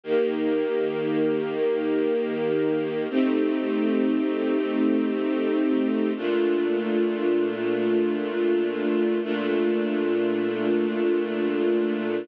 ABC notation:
X:1
M:5/4
L:1/8
Q:1/4=98
K:Bb
V:1 name="String Ensemble 1"
[E,B,G]10 | [A,CEG]10 | [B,,A,DF]10 | [B,,A,DF]10 |]